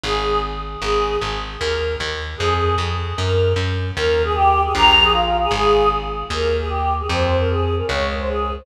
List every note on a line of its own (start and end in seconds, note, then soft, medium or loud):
0.04 0.76 G#1 loud
0.04 0.40 G#4 loud
0.81 1.17 G#1 medium
0.81 1.17 G#4 loud
1.21 1.57 G#1 medium
1.60 1.96 D#2 medium
1.60 1.95 A#4 loud
2.00 2.35 D#2 medium
2.38 2.75 F2 medium
2.38 2.75 G#4 loud
2.78 3.13 F2 medium
3.17 3.53 F#2 medium
3.17 3.52 A#4 loud
3.56 3.91 F#2 medium
3.97 4.69 D#2 loud
3.97 4.22 A#4 loud
4.24 4.33 G#4 loud
4.34 4.62 G4 loud
4.64 4.73 G#4 loud
4.75 5.47 A#1 loud
4.75 5.04 A#5 loud
5.03 5.12 G#4 loud
5.12 5.37 F4 loud
5.42 5.52 G#4 loud
5.51 6.23 G#1 loud
5.51 5.89 G#4 loud
6.30 7.02 D#2 loud
6.30 6.56 A#4 loud
6.59 6.69 G#4 loud
6.69 6.94 G4 medium
6.99 7.09 G#4 medium
7.09 7.82 F2 loud
7.09 7.36 C5 loud
7.40 7.49 A#4 loud
7.49 7.75 G#4 loud
7.77 7.87 A#4 medium
7.87 8.61 C#2 loud
7.87 8.11 C#5 loud
8.18 8.28 C5 loud
8.27 8.54 G#4 medium
8.56 8.65 C5 medium